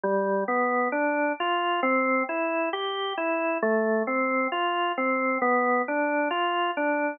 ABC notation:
X:1
M:4/4
L:1/8
Q:1/4=67
K:C
V:1 name="Drawbar Organ"
G, B, D F C E G E | A, C F C B, D F D |]